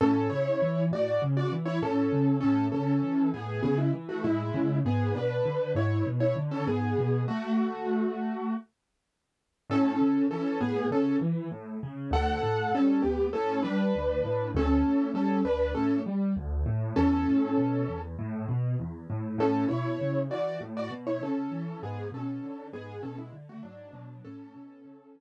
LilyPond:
<<
  \new Staff \with { instrumentName = "Acoustic Grand Piano" } { \time 4/4 \key a \major \tempo 4 = 99 <cis' a'>8 <e' cis''>4 <fis' d''>8 r16 <fis' d''>16 r16 <e' cis''>16 <cis' a'>4 | <cis' a'>8 <cis' a'>4 <b gis'>8 <b gis'>16 <gis e'>16 r16 <a fis'>16 <gis e'>4 | <b gis'>8 <d' b'>4 <e' cis''>8 r16 <e' cis''>16 r16 <cis' a'>16 <b gis'>4 | <a fis'>2~ <a fis'>8 r4. |
<cis' a'>4 <cis' a'>8 <b gis'>8 <cis' a'>8 r4. | <a' fis''>4 <cis' a'>8 <b g'>8 <cis' a'>8 <d' b'>4. | <cis' a'>4 <cis' a'>8 <d' b'>8 <cis' a'>8 r4. | <cis' a'>2 r2 |
<cis' a'>8 <e' cis''>4 <fis' d''>8 r16 <fis' d''>16 r16 <e' cis''>16 <cis' a'>4 | <b gis'>8 <cis' a'>4 <b gis'>8 <cis' a'>16 <gis e'>16 r16 <a fis'>16 <fis d'>4 | <cis' a'>2~ <cis' a'>8 r4. | }
  \new Staff \with { instrumentName = "Acoustic Grand Piano" } { \clef bass \time 4/4 \key a \major a,8 cis8 e8 a,8 cis8 e8 a,8 cis8 | a,8 cis8 e8 a,8 cis8 e8 a,8 cis8 | gis,8 b,8 d8 gis,8 b,8 d8 gis,8 b,8 | r1 |
a,8 cis8 e8 a,8 cis8 e8 a,8 cis8 | d,8 a,8 g8 d,8 a,8 g8 d,8 a,8 | d,8 a,8 g8 d,8 a,8 g8 d,8 a,8 | e,8 a,8 b,8 e,8 a,8 b,8 e,8 a,8 |
a,8 b,8 cis8 e8 a,8 b,8 cis8 e8 | gis,8 b,8 d8 gis,8 b,8 d8 gis,8 b,8 | a,8 b,8 cis8 e8 r2 | }
>>